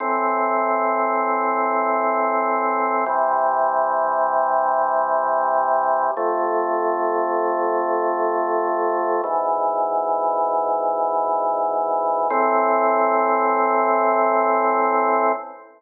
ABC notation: X:1
M:4/4
L:1/8
Q:1/4=78
K:Am
V:1 name="Drawbar Organ"
[A,,E,C]8 | [C,E,G,]8 | [F,,C,A,]8 | [^G,,B,,E,]8 |
[A,,E,C]8 |]